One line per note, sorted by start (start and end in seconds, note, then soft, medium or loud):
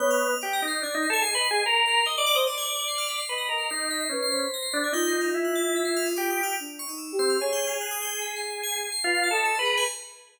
0.00 0.35 B3 medium
0.00 0.27 C#5 loud
0.00 0.09 G6 medium
0.11 0.38 F6 loud
0.30 0.58 D#5 medium
0.41 0.61 G4 medium
0.41 0.54 D6 medium
0.53 0.66 A#6 loud
0.62 0.81 D#4 medium
0.68 0.80 C7 medium
0.81 0.94 D4 medium
0.81 1.05 D5 medium
0.81 0.93 G#6 medium
0.93 1.07 D#4 loud
0.93 1.02 B6 medium
1.02 1.12 C7 medium
1.09 1.22 A4 loud
1.09 1.33 D#5 medium
1.13 1.23 G#6 loud
1.22 1.34 G#4 medium
1.22 1.32 C7 loud
1.34 1.47 B4 medium
1.34 1.43 C7 medium
1.39 1.63 D#5 medium
1.44 1.53 C7 loud
1.51 1.63 G#4 loud
1.51 1.64 C7 medium
1.66 2.03 A#4 loud
1.66 1.75 C7 medium
1.86 2.04 C7 medium
2.06 2.15 D#5 medium
2.06 2.17 D#5 medium
2.06 2.15 G#6 medium
2.17 2.36 D5 loud
2.17 2.30 D#5 medium
2.17 2.27 A6 medium
2.26 2.36 D6 loud
2.35 2.47 C5 loud
2.35 2.45 D#5 medium
2.47 3.21 D5 medium
2.47 2.56 C6 medium
2.58 2.85 G#6 loud
2.88 2.97 C7 medium
2.98 3.07 F6 loud
3.08 3.18 B6 medium
3.17 3.27 C7 medium
3.28 3.48 B4 medium
3.28 3.49 D#5 medium
3.28 3.37 C7 medium
3.38 3.47 A#6 medium
3.49 3.67 A#4 medium
3.49 4.04 D#5 loud
3.58 3.67 C7 medium
3.70 4.08 D#4 medium
3.70 3.89 C7 loud
3.91 4.00 B6 loud
4.01 4.10 C7 loud
4.09 4.46 C#4 medium
4.09 4.30 B4 medium
4.22 4.32 C7 loud
4.30 4.86 C5 medium
4.30 4.50 B6 medium
4.54 4.63 A#6 loud
4.63 4.72 C7 medium
4.72 4.92 D4 medium
4.72 4.81 B6 medium
4.84 4.93 G#6 medium
4.93 5.30 D#4 medium
4.93 6.41 F4 loud
4.93 5.06 G6 loud
5.07 5.20 C7 medium
5.21 5.33 F6 medium
5.34 6.08 E4 medium
5.45 5.54 F#6 medium
5.55 5.74 A6 loud
5.76 5.85 B6 medium
5.85 5.94 C7 medium
5.96 6.06 F6 loud
6.06 6.15 D#6 medium
6.16 6.55 G4 medium
6.16 6.29 D6 loud
6.30 6.43 D#6 loud
6.43 6.55 F6 loud
6.60 6.84 D4 medium
6.79 6.88 C#6 loud
6.87 7.12 D#4 medium
6.87 6.98 D#6 medium
6.98 7.16 E6 medium
7.12 7.37 G4 medium
7.19 7.37 C4 medium
7.19 7.28 C7 loud
7.30 7.39 F6 medium
7.40 8.89 G#4 medium
7.40 7.77 C#5 loud
7.40 7.52 C#6 medium
7.53 7.65 G6 loud
7.67 7.79 F6 medium
7.81 7.90 F#6 loud
7.91 8.00 D#6 loud
8.02 8.20 G6 medium
8.22 8.34 B6 medium
8.36 8.49 C7 medium
8.50 8.63 C7 medium
8.63 8.73 G#6 loud
8.74 8.83 C7 medium
8.83 8.92 C7 medium
8.92 9.02 C7 loud
9.04 9.29 F4 loud
9.04 9.29 B4 medium
9.15 9.24 C7 medium
9.24 9.33 A6 medium
9.31 9.55 A4 loud
9.31 9.56 D#5 medium
9.31 9.44 B6 medium
9.45 9.54 E6 medium
9.55 9.84 B4 medium
9.55 9.64 C6 medium
9.60 9.84 G#4 medium
9.65 9.74 A#5 medium
9.77 9.87 G#5 loud